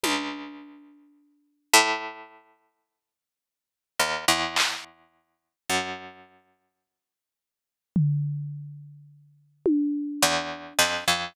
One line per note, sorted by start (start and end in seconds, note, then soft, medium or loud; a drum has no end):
0.04 1.57 C#2 medium
0.04 high tom soft
1.74 3.77 A2 loud
4.00 4.25 D#2 medium
4.28 5.55 E2 medium
4.56 clap loud
5.70 9.77 F#2 medium
7.96 floor tom medium
9.66 high tom medium
10.22 10.73 E2 medium
10.79 11.04 F2 medium
10.79 clap medium
11.08 11.33 F2 medium